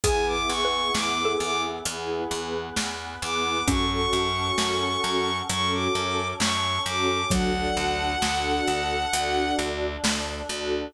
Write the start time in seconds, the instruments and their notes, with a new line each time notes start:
0.04 electric bass (finger) E2, choir aahs B3 E4 G#4, string ensemble 1 B3 E4 G#4, xylophone G#4, violin G#5, kick, closed hi-hat
0.27 violin D6
0.49 electric bass (finger) E2, violin C#6
0.65 xylophone B4
0.72 string ensemble 1 B3 E4 G#4
0.95 electric bass (finger) E2, string ensemble 1 B3 E4 G#4, violin D6, snare
1.25 xylophone A4
1.40 electric bass (finger) E2, violin D6
1.85 electric bass (finger) E2, string ensemble 1 B3 E4 G#4, choir aahs B3 G#4 B4, closed hi-hat
2.31 electric bass (finger) E2
2.77 electric bass (finger) E2, snare
3.22 electric bass (finger) E2, string ensemble 1 B3 E4 G#4, violin D6
3.68 electric bass (finger) F#2, string ensemble 1 C#4 F#4 A4, choir aahs C#4 F#4 A4, xylophone C#4, violin C#6, kick, closed hi-hat
3.91 violin C#6
4.13 electric bass (finger) F#2
4.36 string ensemble 1 C#4 F#4 A4
4.58 electric bass (finger) F#2, string ensemble 1 C#4 F#4 A4, snare
5.04 electric bass (finger) F#2
5.49 electric bass (finger) F#2, string ensemble 1 C#4 F#4 A4, choir aahs C#4 A4 C#5, violin C#6, closed hi-hat
5.72 violin D6
5.95 electric bass (finger) F#2
6.40 electric bass (finger) F#2, violin C#6, snare
6.86 electric bass (finger) F#2, string ensemble 1 C#4 F#4 A4, violin D6
7.30 electric bass (finger) D2, xylophone F#3, string ensemble 1 D4 F#4 A4, choir aahs D4 F#4 A4, violin F#5, kick, closed hi-hat
7.77 electric bass (finger) D2
8.00 string ensemble 1 D4 F#4 A4
8.22 electric bass (finger) D2, string ensemble 1 D4 F#4 A4, snare
8.67 electric bass (finger) D2
9.13 electric bass (finger) D2, string ensemble 1 D4 F#4 A4, choir aahs D4 A4 D5, closed hi-hat
9.59 electric bass (finger) D2
10.04 electric bass (finger) D2, snare
10.49 electric bass (finger) D2, string ensemble 1 D4 F#4 A4